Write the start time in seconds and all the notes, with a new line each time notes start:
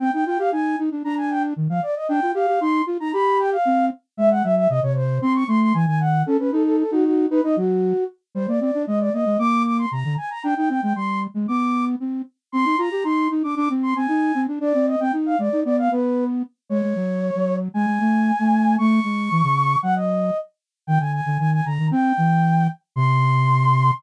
0.00 C4 G5
0.13 D#4 G5
0.26 F4 G5
0.39 G4 F5
0.52 D#4 G#5
0.79 D#4
0.91 D4
1.04 D4 A#5
1.17 G#5
1.30 G5
1.56 D#3
1.69 F3 F5
1.83 D5
1.96 D#5
2.09 D4 G5
2.22 F4
2.34 G4 F5
2.48 G4
2.61 D#4 C6
2.86 F4
3.00 D#4 A#5
3.13 G4 B5
3.39 G5
3.52 F5
3.65 C4
4.17 G#3 E5
4.31 F#5
4.43 F#3 E5
4.56 E5
4.69 C3 D#5
4.83 C3 C#5
4.96 C5
5.22 C4 C6
5.35 C#6
5.48 A3 C6
5.61 C6
5.74 E3 G#5
5.87 D#3 G#5
6.00 F#5
6.26 C#4 A4
6.39 C#4 B4
6.52 D#4 A4
6.65 A4
6.78 A4
6.91 D#4 F#4
7.04 F#4
7.30 D#4 B4
7.44 D#4 D#5
7.56 F#3 F#4
8.35 G3 C5
8.48 A#3 D5
8.61 C4 D5
8.74 D4
8.87 G#3 D#5
9.00 D5
9.13 A#3 D#5
9.26 G#3
9.39 A#3 D6
9.65 D6
9.78 C6
9.91 C3 A#5
10.05 D3
10.17 G#5
10.30 A#5
10.44 D4 G5
10.57 D#4 G5
10.69 C4 G5
10.83 G#3 G5
10.96 G3 C6
11.34 G#3
11.48 B3 D6
12.00 C4
12.52 C4 C6
12.65 D#4
12.78 F4 A#5
12.91 G4
13.04 D#4 C6
13.30 D#4
13.43 D4 D6
13.56 D4 D6
13.70 C4
13.83 C6
13.96 C4 G#5
14.08 D#4
14.35 C4
14.48 D4
14.60 D4 D5
14.74 C4
14.87 D#5
15.00 C4 G5
15.13 D#4
15.26 F5
15.39 G#3 D5
15.52 D#4
15.65 B3 D5
15.78 F5
15.91 B3 B4
16.69 G#3 C#5
16.83 G#3
16.96 F#3
17.35 F#3
17.74 G#3 G#5
17.87 G#3
18.00 A3
18.39 A3
18.78 A3 C#6
19.04 G#3
19.31 E3
19.43 C#3
19.83 F#3 F#5
19.96 D#5
20.87 D#3 G5
21.00 D3 G#5
21.13 G#5
21.26 D3
21.39 D#3 G#5
21.52 G#5
21.65 D3 A#5
21.79 D#3
21.91 C4 G5
22.17 E3
22.96 C3 C6